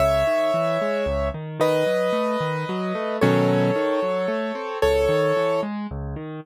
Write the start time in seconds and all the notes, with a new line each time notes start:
0.00 C#2 C#5 E5
0.27 D#3
0.54 E3
0.81 G#3
1.06 C#2
1.34 D#3
1.60 D#3 B4 D#5
1.86 F#3
2.13 A3
2.41 D#3
2.69 F#3
2.95 A3
3.21 B2 D#3 F#3 C#4 A4 C#5
3.76 D#3
4.02 F#3
4.28 A3
4.55 C4
4.82 C#2 A4 C#5
5.09 D#3
5.37 E3
5.63 G#3
5.91 C#2
6.16 D#3